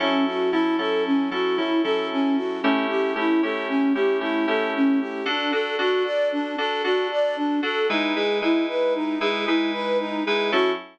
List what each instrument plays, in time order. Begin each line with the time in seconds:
0.00 electric piano 2 F#3 C#4 E4 A4, flute C#4
0.26 flute F#4
0.51 electric piano 2 F#3 C#4 E4 A4, flute E4
0.79 electric piano 2 F#3 C#4 E4 A4, flute A4
1.06 flute C#4
1.31 electric piano 2 F#3 C#4 E4 A4, flute F#4
1.56 electric piano 2 F#3 C#4 E4 A4, flute E4
1.83 electric piano 2 F#3 C#4 E4 A4, flute A4
2.12 flute C#4
2.36 flute F#4
2.62 electric piano 2 A3 C#4 E4 G4, flute C#4
2.89 flute G4
3.15 electric piano 2 A3 C#4 E4 G4, flute E4
3.42 electric piano 2 A3 C#4 E4 G4, flute A4
3.69 flute C#4
3.93 electric piano 2 A3 C#4 E4 G4, flute G4
4.21 electric piano 2 A3 C#4 E4 G4, flute E4
4.47 electric piano 2 A3 C#4 E4 G4, flute A4
4.75 flute C#4
5.00 flute G4
5.26 electric piano 2 D4 F#4 A4, flute D4
5.51 electric piano 2 D4 F#4 A4, flute A4
5.79 electric piano 2 D4 F#4 A4, flute F#4
6.04 flute D5
6.32 flute D4
6.58 electric piano 2 D4 F#4 A4, flute A4
6.84 electric piano 2 D4 F#4 A4, flute F#4
7.11 flute D5
7.36 flute D4
7.63 electric piano 2 D4 F#4 A4, flute A4
7.89 electric piano 2 G#3 D#4 E4 B4, flute D#4
8.15 electric piano 2 G#3 D#4 E4 B4, flute G#4
8.42 electric piano 2 G#3 D#4 E4 B4, flute E4
8.69 flute B4
8.95 flute D#4
9.20 electric piano 2 G#3 D#4 E4 B4, flute G#4
9.46 electric piano 2 G#3 D#4 E4 B4, flute E4
9.73 flute B4
10.00 flute D#4
10.26 electric piano 2 G#3 D#4 E4 B4, flute G#4
10.52 electric piano 2 F#3 C#4 E4 A4, flute F#4